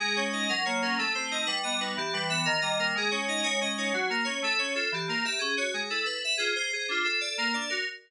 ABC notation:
X:1
M:6/8
L:1/8
Q:3/8=122
K:Ddor
V:1 name="Electric Piano 2"
^G ^c ^d ^A c A | A c _e B ^d B | G B e _B _e B | ^G ^c ^d c d c |
^F ^A ^c =A c A | G _B e ^G ^c G | A B e _A c A | F A d _B d B |]
V:2 name="Electric Piano 2"
^G, ^C ^D ^F, ^A, C | A, C _E G, B, ^D | E, G, B, _E, G, _B, | ^G, ^C ^D G, C D |
^F, ^A, ^C =A, C ^E | E, _B, G ^C ^F ^G, | E A B F _A c | D F A _B, D ^F |]